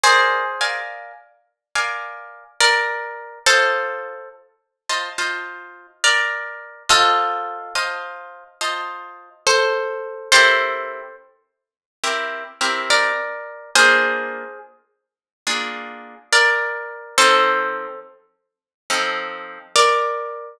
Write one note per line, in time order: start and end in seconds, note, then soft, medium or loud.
0.03 0.80 G#4 medium
0.03 0.43 A#4 medium
0.03 0.80 C5 loud
0.03 0.43 D5 medium
0.03 0.43 F5 medium
0.03 0.43 G#5 medium
0.61 1.12 A#4 medium
0.61 1.12 D5 medium
0.61 1.12 F5 medium
0.61 1.12 G#5 medium
1.75 2.44 A#4 medium
1.75 2.44 D5 medium
1.75 2.44 F5 medium
1.75 2.44 G#5 medium
2.60 3.39 A#4 medium
2.60 3.39 D5 medium
3.46 4.15 F4 medium
3.46 4.29 A4 medium
3.46 4.29 C5 medium
3.46 4.15 D#5 medium
3.46 4.15 A5 medium
4.89 5.09 F4 medium
4.89 5.09 C5 medium
4.89 5.09 D#5 medium
4.89 5.09 A5 medium
5.18 5.87 F4 medium
5.18 5.87 C5 medium
5.18 5.87 D#5 medium
5.18 5.87 A5 medium
6.04 6.83 A#4 medium
6.04 6.83 D5 medium
6.89 7.74 F4 medium
6.89 7.74 A4 loud
6.89 7.58 C5 medium
6.89 7.58 D#5 medium
6.89 7.58 A5 medium
7.75 8.44 F4 medium
7.75 8.44 C5 medium
7.75 8.44 D#5 medium
7.75 8.44 A5 medium
8.61 9.29 F4 medium
8.61 9.29 C5 medium
8.61 9.29 D#5 medium
8.61 9.29 A5 medium
9.47 10.29 A4 medium
9.47 10.29 C5 medium
10.32 11.01 C4 medium
10.32 11.01 E4 medium
10.32 11.01 G4 medium
10.32 11.16 A4 medium
10.32 11.01 A#4 medium
10.32 11.16 C5 loud
12.04 12.44 C4 medium
12.04 12.44 E4 medium
12.04 12.44 G4 medium
12.04 12.44 A#4 medium
12.61 13.12 C4 medium
12.61 13.12 E4 medium
12.61 13.12 G4 medium
12.61 13.12 A#4 medium
12.90 13.71 A#4 medium
12.90 13.71 D5 medium
13.75 14.44 A#3 medium
13.75 14.44 D4 medium
13.75 14.44 F4 medium
13.75 14.59 G#4 medium
13.75 14.59 C5 loud
15.47 16.15 A#3 medium
15.47 16.15 D4 medium
15.47 16.15 F4 medium
15.47 16.15 G#4 medium
16.33 17.16 A#4 medium
16.33 17.16 D5 medium
17.18 17.87 F3 medium
17.18 17.87 C4 medium
17.18 17.87 D#4 medium
17.18 18.00 A4 medium
17.18 18.00 C5 loud
18.90 19.59 F3 medium
18.90 19.59 C4 medium
18.90 19.59 D#4 medium
18.90 19.59 A4 medium
19.76 20.58 A#4 medium
19.76 20.58 D5 medium